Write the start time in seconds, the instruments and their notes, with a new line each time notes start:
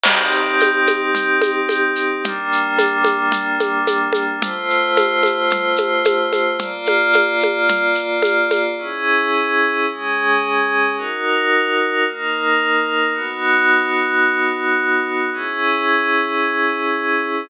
0.04 pad 5 (bowed) C4 D#4 G4, crash, low conga, shaker
0.31 shaker
0.60 high conga, shaker
0.87 high conga, shaker
1.15 low conga, shaker
1.42 high conga, shaker
1.69 high conga, shaker
1.96 shaker
2.24 pad 5 (bowed) G3 A#3 D4, low conga, shaker
2.52 shaker
2.79 high conga, shaker
3.04 high conga, shaker
3.32 low conga, shaker
3.60 high conga, shaker
3.87 high conga, shaker
4.13 high conga, shaker
4.41 pad 5 (bowed) A3 F4 C5, low conga, shaker
4.70 shaker
4.96 high conga, shaker
5.23 high conga, shaker
5.50 low conga, shaker
5.76 high conga, shaker
6.05 high conga, shaker
6.33 high conga, shaker
6.59 pad 5 (bowed) A#3 F4 D5, low conga, shaker
6.86 high conga, shaker
7.13 high conga, shaker
7.40 high conga, shaker
7.69 low conga, shaker
7.95 shaker
8.23 high conga, shaker
8.51 high conga, shaker
8.78 pad 5 (bowed) C#4 E4 G#4
9.88 pad 5 (bowed) G#3 C#4 G#4
10.96 pad 5 (bowed) D#4 F#4 A#4
12.05 pad 5 (bowed) A#3 D#4 A#4
13.14 pad 5 (bowed) B3 D#4 F#4
15.33 pad 5 (bowed) C#4 E4 G#4